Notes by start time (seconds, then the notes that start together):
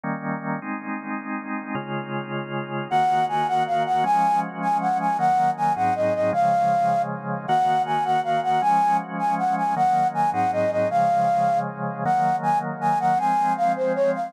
0.03 D#3 G3 A#3 C#4
0.62 G#3 C4 D#4
1.75 C#3 G#3 F4
2.90 D#3 A#3 F#4 F#5
3.29 G#5
3.48 F#5
3.67 F5
3.86 F#5
4.04 F3 G#3 C#4 G#5
4.62 G#5
4.81 F#5
5.00 G#5
5.19 D#3 F#3 A#3 F#5
5.57 G#5
5.76 G#2 F#3 C4 D#4 F#5
5.95 D#5
6.14 D#5
6.33 C#3 F3 G#3 F5
7.48 D#3 A#3 F#4 F#5
7.86 G#5
8.05 F#5
8.24 F5
8.43 F#5
8.62 F3 G#3 C#4 G#5
9.19 G#5
9.38 F#5
9.57 G#5
9.76 D#3 F#3 A#3 F#5
10.14 G#5
10.33 G#2 F#3 C4 D#4 F#5
10.52 D#5
10.71 D#5
10.90 C#3 F3 G#3 F5
12.05 D#3 F#3 A#3 F#5
12.43 G#5
12.81 G#5
13.00 F#5
13.18 F3 G#3 C4 G#5
13.57 F5
13.76 C5
13.95 C#5
14.14 F5